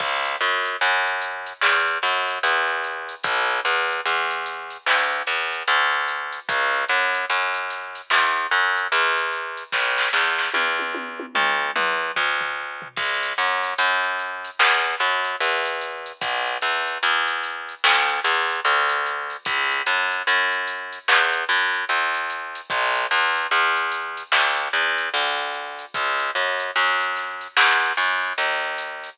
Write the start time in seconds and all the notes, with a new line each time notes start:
0.00 C#2, kick, crash
0.25 closed hi-hat
0.41 F#2, closed hi-hat
0.65 closed hi-hat
0.81 F#2, closed hi-hat
1.06 closed hi-hat
1.21 closed hi-hat
1.46 closed hi-hat
1.61 E2, clap
1.87 closed hi-hat
2.02 F#2, snare, closed hi-hat
2.27 closed hi-hat
2.43 E2, closed hi-hat
2.68 closed hi-hat
2.84 closed hi-hat
3.09 closed hi-hat
3.23 B1, kick, closed hi-hat
3.49 closed hi-hat
3.65 E2, snare, closed hi-hat
3.90 closed hi-hat
4.06 E2, closed hi-hat
4.31 closed hi-hat
4.46 closed hi-hat
4.70 closed hi-hat
4.86 D2, clap
5.12 closed hi-hat
5.27 E2, closed hi-hat
5.52 closed hi-hat
5.67 D2, closed hi-hat
5.92 closed hi-hat
6.08 closed hi-hat
6.32 closed hi-hat
6.49 C#2, kick, closed hi-hat
6.74 closed hi-hat
6.88 F#2, closed hi-hat
7.14 closed hi-hat
7.30 F#2, closed hi-hat
7.54 closed hi-hat
7.70 snare, closed hi-hat
7.95 closed hi-hat
8.10 E2, clap
8.36 closed hi-hat
8.51 F#2, closed hi-hat
8.76 closed hi-hat
8.92 E2, closed hi-hat
9.17 closed hi-hat
9.32 closed hi-hat
9.57 closed hi-hat
9.72 B1, kick, snare
9.98 snare
10.13 E2, snare
10.38 snare
10.54 E2, high tom
10.79 high tom
10.95 high tom
11.20 high tom
11.35 D2, mid tom
11.76 E2, mid tom
12.16 D2, floor tom
12.41 floor tom
12.82 floor tom
12.96 C#2, kick, crash
13.23 closed hi-hat
13.38 F#2, closed hi-hat
13.63 closed hi-hat
13.78 F#2, closed hi-hat
14.04 closed hi-hat
14.19 closed hi-hat
14.44 closed hi-hat
14.59 E2, snare
14.85 closed hi-hat
15.00 F#2, closed hi-hat
15.24 closed hi-hat
15.40 E2, closed hi-hat
15.65 closed hi-hat
15.81 closed hi-hat
16.06 closed hi-hat
16.21 B1, kick, closed hi-hat
16.46 closed hi-hat
16.61 E2, closed hi-hat
16.87 closed hi-hat
17.03 E2, closed hi-hat
17.28 closed hi-hat
17.43 closed hi-hat
17.69 closed hi-hat
17.84 D2, snare
18.09 closed hi-hat
18.24 E2, closed hi-hat
18.50 closed hi-hat
18.65 D2, closed hi-hat
18.89 closed hi-hat
19.06 closed hi-hat
19.30 closed hi-hat
19.45 C#2, kick, closed hi-hat
19.71 closed hi-hat
19.86 F#2, closed hi-hat
20.11 closed hi-hat
20.27 F#2, closed hi-hat
20.52 closed hi-hat
20.67 closed hi-hat
20.92 closed hi-hat
21.08 E2, clap
21.33 closed hi-hat
21.49 F#2, closed hi-hat
21.74 closed hi-hat
21.89 E2, closed hi-hat
22.14 closed hi-hat
22.30 closed hi-hat
22.55 closed hi-hat
22.70 B1, kick, closed hi-hat
22.95 closed hi-hat
23.11 E2, closed hi-hat
23.36 closed hi-hat
23.51 E2, closed hi-hat
23.76 closed hi-hat
23.92 closed hi-hat
24.17 closed hi-hat
24.32 D2, snare
24.57 closed hi-hat
24.73 E2, closed hi-hat
24.98 closed hi-hat
25.14 D2, closed hi-hat
25.38 closed hi-hat
25.54 closed hi-hat
25.79 closed hi-hat
25.94 C#2, kick, closed hi-hat
26.20 closed hi-hat
26.35 F#2, closed hi-hat
26.60 closed hi-hat
26.76 F#2, closed hi-hat
27.01 closed hi-hat
27.16 snare, closed hi-hat
27.41 closed hi-hat
27.57 E2, snare
27.83 closed hi-hat
27.97 F#2, closed hi-hat
28.22 closed hi-hat
28.38 D#2, closed hi-hat
28.63 closed hi-hat
28.78 closed hi-hat
29.04 closed hi-hat